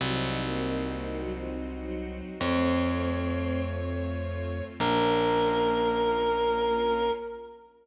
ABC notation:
X:1
M:4/4
L:1/16
Q:1/4=100
K:Bbm
V:1 name="Clarinet"
z16 | d16 | B16 |]
V:2 name="Choir Aahs"
G,3 B,3 B,2 G, F, z2 G,4 | C10 z6 | B,16 |]
V:3 name="String Ensemble 1"
[CEG]16 | [=A,CF]16 | [B,DF]16 |]
V:4 name="Electric Bass (finger)" clef=bass
C,,16 | F,,16 | B,,,16 |]
V:5 name="String Ensemble 1"
[CEG]16 | [=A,CF]16 | [B,DF]16 |]